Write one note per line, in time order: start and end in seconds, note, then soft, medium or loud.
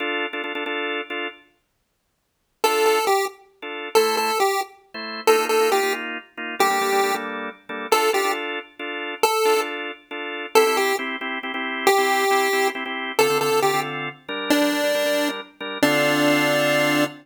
0.00 0.26 D4 loud
0.00 0.26 F4 loud
0.00 0.26 A4 loud
0.33 0.42 D4 medium
0.33 0.42 F4 medium
0.33 0.42 A4 medium
0.44 0.53 D4 medium
0.44 0.53 F4 medium
0.44 0.53 A4 medium
0.55 0.64 D4 medium
0.55 0.64 F4 medium
0.55 0.64 A4 medium
0.66 1.01 D4 medium
0.66 1.01 F4 medium
0.66 1.01 A4 loud
1.10 1.28 D4 medium
1.10 1.28 F4 medium
1.10 1.28 A4 medium
2.64 2.99 D4 medium
2.64 2.99 F4 medium
2.64 2.85 A4 medium
2.64 2.99 A4 medium
2.86 3.05 A4 medium
3.07 3.26 G4 medium
3.62 3.89 D4 medium
3.62 3.89 F4 medium
3.62 3.89 A4 medium
3.95 4.31 A3 medium
3.95 4.31 E4 medium
3.95 4.16 A4 medium
3.95 4.31 C5 medium
4.17 4.39 A4 medium
4.40 4.61 G4 medium
4.94 5.21 A3 medium
4.94 5.21 E4 medium
4.94 5.21 C5 medium
5.27 5.36 A#3 medium
5.27 5.36 D#4 medium
5.27 5.36 F4 medium
5.27 5.45 A4 loud
5.39 5.47 A#3 medium
5.39 5.47 D#4 medium
5.39 5.47 F4 medium
5.49 5.58 A#3 medium
5.49 5.58 D#4 medium
5.49 5.58 F4 medium
5.49 5.70 A4 medium
5.60 5.69 A#3 medium
5.60 5.69 D#4 medium
5.60 5.69 F4 medium
5.71 5.80 A#3 medium
5.71 5.80 D#4 medium
5.71 5.80 F4 medium
5.71 5.93 G4 medium
5.83 6.18 A#3 medium
5.83 6.18 D#4 medium
5.83 6.18 F4 medium
6.37 6.55 A#3 medium
6.37 6.55 D#4 medium
6.37 6.55 F4 medium
6.59 6.68 G3 medium
6.59 6.68 A#3 medium
6.59 6.68 D4 medium
6.59 7.15 G4 medium
6.59 6.68 A4 medium
6.70 6.79 G3 medium
6.70 6.79 A#3 medium
6.70 6.79 D4 medium
6.70 6.79 A4 medium
6.81 6.90 G3 medium
6.81 6.90 A#3 medium
6.81 6.90 D4 medium
6.81 6.90 A4 medium
6.92 7.01 G3 medium
6.92 7.01 A#3 medium
6.92 7.01 D4 medium
6.92 7.01 A4 medium
7.03 7.12 G3 medium
7.03 7.12 A#3 medium
7.03 7.12 D4 medium
7.03 7.12 A4 medium
7.14 7.49 G3 medium
7.14 7.49 A#3 medium
7.14 7.49 D4 medium
7.14 7.49 A4 medium
7.69 7.87 G3 medium
7.69 7.87 A#3 medium
7.69 7.87 D4 medium
7.69 7.87 A4 medium
7.91 8.09 D4 medium
7.91 8.09 F4 medium
7.91 8.09 A4 medium
7.91 8.11 A4 loud
8.13 8.22 D4 medium
8.13 8.22 F4 medium
8.13 8.32 G4 medium
8.13 8.22 A4 medium
8.24 8.59 D4 medium
8.24 8.59 F4 medium
8.24 8.59 A4 medium
8.79 9.14 D4 medium
8.79 9.14 F4 medium
8.79 9.14 A4 medium
9.23 9.61 A4 loud
9.45 9.54 D4 medium
9.45 9.54 F4 medium
9.45 9.54 A4 medium
9.56 9.91 D4 medium
9.56 9.91 F4 medium
9.56 9.91 A4 medium
10.11 10.46 D4 medium
10.11 10.46 F4 medium
10.11 10.46 A4 medium
10.55 10.64 C4 medium
10.55 10.64 E4 medium
10.55 10.64 G4 medium
10.55 10.77 A4 loud
10.66 10.92 C4 medium
10.66 10.92 E4 medium
10.66 10.92 G4 medium
10.77 10.96 G4 loud
10.99 11.16 C4 medium
10.99 11.16 E4 medium
10.99 11.16 G4 medium
11.21 11.39 C4 medium
11.21 11.39 E4 medium
11.21 11.39 G4 medium
11.43 11.52 C4 medium
11.43 11.52 E4 medium
11.43 11.52 G4 medium
11.54 11.89 C4 medium
11.54 11.89 E4 medium
11.54 11.89 G4 medium
11.87 12.68 G4 loud
11.98 12.24 C4 medium
11.98 12.24 E4 medium
11.98 12.24 G4 medium
12.30 12.48 C4 medium
12.30 12.48 E4 medium
12.30 12.48 G4 medium
12.53 12.70 C4 medium
12.53 12.70 E4 medium
12.53 12.70 G4 medium
12.75 12.84 C4 medium
12.75 12.84 E4 medium
12.75 12.84 G4 medium
12.86 13.12 C4 medium
12.86 13.12 E4 medium
12.86 13.12 G4 medium
13.19 13.27 D3 medium
13.19 13.27 C4 medium
13.19 13.27 F4 medium
13.19 13.27 A4 medium
13.19 13.38 A4 loud
13.30 13.38 D3 medium
13.30 13.38 C4 medium
13.30 13.38 F4 medium
13.30 13.38 A4 medium
13.41 13.50 D3 medium
13.41 13.50 C4 medium
13.41 13.50 F4 medium
13.41 13.50 A4 medium
13.41 13.60 A4 medium
13.52 13.60 D3 medium
13.52 13.60 C4 medium
13.52 13.60 F4 medium
13.52 13.60 A4 medium
13.62 13.71 D3 medium
13.62 13.71 C4 medium
13.62 13.71 F4 medium
13.62 13.80 G4 medium
13.62 13.71 A4 medium
13.74 14.09 D3 medium
13.74 14.09 C4 medium
13.74 14.09 F4 medium
13.74 14.09 A4 medium
14.28 14.59 G3 medium
14.28 14.59 D4 medium
14.28 14.59 A#4 medium
14.50 15.29 D4 loud
14.61 14.70 G3 medium
14.61 14.70 D4 medium
14.61 14.70 A#4 medium
14.72 14.81 G3 medium
14.72 14.81 D4 medium
14.72 14.81 A#4 medium
14.83 14.92 G3 medium
14.83 14.92 D4 medium
14.83 14.92 A#4 medium
14.95 15.03 G3 medium
14.95 15.03 D4 medium
14.95 15.03 A#4 medium
15.05 15.41 G3 medium
15.05 15.41 D4 medium
15.05 15.41 A#4 medium
15.60 15.78 G3 medium
15.60 15.78 D4 medium
15.60 15.78 A#4 medium
15.82 17.05 D3 medium
15.82 17.05 C4 loud
15.82 17.04 D4 loud
15.82 17.05 F4 loud
15.82 17.05 A4 medium